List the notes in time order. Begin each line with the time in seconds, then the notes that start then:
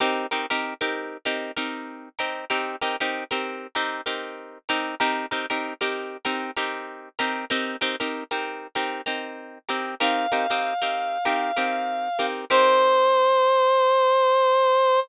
0.00 C4 D#4 G4 A#4
0.31 C4 D#4 G4 A#4
0.50 C4 D#4 G4 A#4
0.81 C4 D#4 G4 A#4
1.25 C4 D#4 G4 A#4
1.57 C4 D#4 G4 A#4
2.19 C4 D#4 G4 A#4
2.50 C4 D#4 G4 A#4
2.81 C4 D#4 G4 A#4
3.00 C4 D#4 G4 A#4
3.31 C4 D#4 G4 A#4
3.75 C4 D#4 G4 A#4
4.06 C4 D#4 G4 A#4
4.69 C4 D#4 G4 A#4
5.00 C4 D#4 G4 A#4
5.31 C4 D#4 G4 A#4
5.50 C4 D#4 G4 A#4
5.81 C4 D#4 G4 A#4
6.25 C4 D#4 G4 A#4
6.57 C4 D#4 G4 A#4
7.19 C4 D#4 G4 A#4
7.50 C4 D#4 G4 A#4
7.81 C4 D#4 G4 A#4
8.00 C4 D#4 G4 A#4
8.31 C4 D#4 G4 A#4
8.75 C4 D#4 G4 A#4
9.06 C4 D#4 G4 A#4
9.69 C4 D#4 G4 A#4
10.00 C4 D#4 G4 A#4 F5
10.32 C4 D#4 G4 A#4
10.50 C4 D#4 G4 A#4
10.82 C4 D#4 G4 A#4
11.25 C4 D#4 G4 A#4
11.56 C4 D#4 G4 A#4
12.19 C4 D#4 G4 A#4
12.50 C4 D#4 G4 A#4 C5